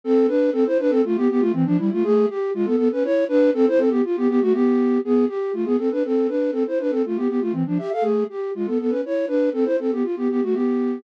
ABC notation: X:1
M:3/4
L:1/16
Q:1/4=120
K:Am
V:1 name="Flute"
[CA]2 [DB]2 | [CA] [Ec] [DB] [CA] [A,F] [B,G] [B,G] [A,F] [E,C] [F,D] [G,E] [A,F] | [A,^G]2 =G2 [^G,^E] [B,A] [B,A] [^CB] [=E^c]2 [DB]2 | [CA] [Ec] [CA] [B,G] F [B,G] [B,G] [A,^F] [B,G]4 |
[B,^G]2 =G2 [A,F] [B,^G] [CA] [DB] [CA]2 [DB]2 | [CA] [Ec] [DB] [CA] [A,F] [B,G] [B,G] [A,F] [E,C] [F,D] [Ge] [Af] | [A,^G]2 =G2 [^G,^E] [B,A] [B,A] [^CB] [=E^c]2 [DB]2 | [CA] [Ec] [CA] [B,G] F [B,G] [B,G] [A,^F] [B,G]4 |]